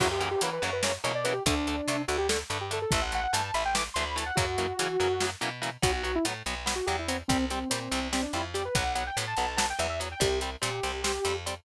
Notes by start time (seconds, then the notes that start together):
0.00 F#2 C#3 E3 F#3 A#3 F#4, kick, crash
0.11 G4
0.20 C#3 E3 F#3 A#3 G4, closed hi-hat
0.31 G4
0.41 C#3 E3 F#3 A#3 B4, closed hi-hat
0.53 B4
0.62 F#2 C#3 E3 F#3 A#3 C#5, closed hi-hat
0.73 B4
0.83 C#3 E3 F#3 A#3 C#5, snare
1.04 B2 C#3 E3 F#3 A#3 C#5, closed hi-hat
1.15 D5
1.24 C#3 E3 F#3 A#3 B4, closed hi-hat
1.33 G4
1.46 D2 D3 A3 D4, kick, closed hi-hat
1.67 D3 A3, closed hi-hat
1.88 C3 D3 A3, closed hi-hat
2.08 D2 D3 A3 F#4, closed hi-hat
2.18 G4
2.29 D3 A3 A4, snare
2.50 G2 D3 A3, closed hi-hat
2.61 G4
2.71 D3 A3 A4, closed hi-hat
2.82 A4
2.91 A1 E3 A3 E5, kick, closed hi-hat
3.02 F#5
3.12 E3 A3 F#5, closed hi-hat
3.24 F#5
3.33 G2 E3 A3 A5, closed hi-hat
3.44 A5
3.54 A1 E3 A3 B5, closed hi-hat
3.65 G5
3.75 E3 A3 D6, snare
3.94 D2 E3 A3 C6, closed hi-hat
4.05 B5
4.16 E3 A3 A5, closed hi-hat
4.26 F#5
4.35 F#2 C#3 E3 F#3 A#3 F#4, kick, closed hi-hat
4.58 C#3 E3 F#3 A#3, closed hi-hat
4.79 C#3 E3 F#3 A#3, closed hi-hat
5.00 F#2 C#3 E3 F#3 A#3, closed hi-hat
5.20 C#3 E3 F#3 A#3, snare
5.41 B2 C#3 E3 F#3 A#3, closed hi-hat
5.62 C#3 E3 F#3 A#3, closed hi-hat
5.82 B1 F#3 B3 F#4, kick, closed hi-hat
5.93 F#4
6.03 F#3 B3 F#4, closed hi-hat
6.15 E4
6.25 A2 F#3 B3, closed hi-hat
6.46 B1 F#3 B3, closed hi-hat
6.66 F#3 B3, snare
6.76 F#4
6.86 E2 F#3 B3 G4, closed hi-hat
6.99 E4
7.08 F#3 B3 C4, closed hi-hat
7.28 C2 G3 C4, kick, closed hi-hat
7.50 G3 C4, closed hi-hat
7.70 A#2 G3 C4, closed hi-hat
7.91 C2 G3 C4, closed hi-hat
8.13 G3 C4, snare
8.23 D4
8.33 F2 G3 C4 E4, closed hi-hat
8.54 G3 C4 G4, closed hi-hat
8.65 B4
8.75 B1 F#3 B3 F#5, kick, closed hi-hat
8.95 F#3 B3 F#5, closed hi-hat
9.07 G5
9.17 A2 F#3 B3, closed hi-hat
9.27 A5
9.37 B1 F#3 B3, closed hi-hat
9.47 A5
9.57 F#3 B3 A5, snare
9.70 G5
9.79 E2 F#3 B3 E5, closed hi-hat
9.89 E5
10.00 F#3 B3, closed hi-hat
10.12 G5
10.20 C2 G3 C4 G4, kick, closed hi-hat
10.41 G3 C4, closed hi-hat
10.61 A#2 G3 C4 G4, closed hi-hat
10.83 C2 G3 C4, closed hi-hat
11.04 G3 C4, snare
11.25 F2 G3 C4, closed hi-hat
11.46 G3 C4, closed hi-hat